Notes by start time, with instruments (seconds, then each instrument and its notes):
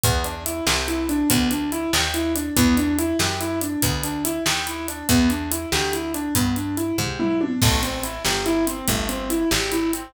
0.03 electric bass (finger) E2, acoustic grand piano B3, kick, closed hi-hat
0.24 acoustic grand piano D4, closed hi-hat
0.46 acoustic grand piano E4, closed hi-hat
0.67 electric bass (finger) C2, acoustic grand piano G4, snare
0.88 acoustic grand piano E4, closed hi-hat
1.09 acoustic grand piano D4, closed hi-hat
1.30 electric bass (finger) D2, acoustic grand piano B3, kick, closed hi-hat
1.51 acoustic grand piano D4, closed hi-hat
1.72 acoustic grand piano E4, closed hi-hat
1.93 electric bass (finger) D#2, acoustic grand piano G4, snare
2.14 acoustic grand piano E4, closed hi-hat
2.35 acoustic grand piano D4, closed hi-hat
2.56 electric bass (finger) E2, acoustic grand piano B3, kick, closed hi-hat
2.77 acoustic grand piano D4, closed hi-hat
2.98 acoustic grand piano E4, closed hi-hat
3.19 electric bass (finger) F#2, acoustic grand piano G4, snare
3.40 acoustic grand piano E4, closed hi-hat
3.61 acoustic grand piano D4, closed hi-hat
3.82 electric bass (finger) D2, acoustic grand piano B3, kick, closed hi-hat
4.03 acoustic grand piano D4, closed hi-hat
4.25 acoustic grand piano E4, closed hi-hat
4.46 electric bass (finger) D#2, acoustic grand piano G4, snare
4.67 acoustic grand piano E4, closed hi-hat
4.88 acoustic grand piano D4, closed hi-hat
5.09 electric bass (finger) E2, acoustic grand piano B3, kick, closed hi-hat
5.30 acoustic grand piano D4, closed hi-hat
5.51 acoustic grand piano E4, closed hi-hat
5.72 electric bass (finger) D2, acoustic grand piano G4, snare
5.93 acoustic grand piano E4, closed hi-hat
6.14 acoustic grand piano D4, closed hi-hat
6.35 electric bass (finger) G2, acoustic grand piano B3, kick, closed hi-hat
6.56 acoustic grand piano D4, closed hi-hat
6.77 acoustic grand piano E4, closed hi-hat
6.98 electric bass (finger) G#2, acoustic grand piano G4, kick, floor tom
7.19 acoustic grand piano E4, mid tom
7.41 acoustic grand piano D4, high tom
7.62 electric bass (finger) A1, acoustic grand piano A3, kick, crash
7.83 acoustic grand piano C4, closed hi-hat
8.03 acoustic grand piano E4, closed hi-hat
8.25 electric bass (finger) G1, acoustic grand piano G4, snare
8.46 acoustic grand piano E4, closed hi-hat
8.67 acoustic grand piano C4, closed hi-hat
8.88 electric bass (finger) G1, acoustic grand piano A3, kick, closed hi-hat
9.09 acoustic grand piano C4, closed hi-hat
9.30 acoustic grand piano E4, closed hi-hat
9.51 electric bass (finger) G#1, acoustic grand piano G4, snare
9.72 acoustic grand piano E4, closed hi-hat
9.93 acoustic grand piano C4, closed hi-hat